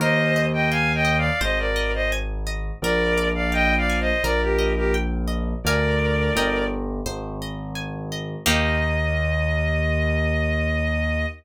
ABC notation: X:1
M:4/4
L:1/16
Q:1/4=85
K:Eb
V:1 name="Violin"
[ce]3 [eg] (3[fa]2 [eg]2 [df]2 [ce] [Bd]2 [ce] z4 | [Bd]3 [df] (3[eg]2 [df]2 [ce]2 [Bd] [GB]2 [GB] z4 | [Bd]6 z10 | e16 |]
V:2 name="Orchestral Harp"
B2 e2 g2 e2 c2 e2 a2 e2 | B2 d2 f2 a2 B2 e2 g2 e2 | [Bdfa]4 [Beg]4 c2 e2 a2 e2 | [B,EG]16 |]
V:3 name="Acoustic Grand Piano" clef=bass
E,,8 A,,,8 | B,,,8 B,,,8 | D,,4 G,,,4 A,,,8 | E,,16 |]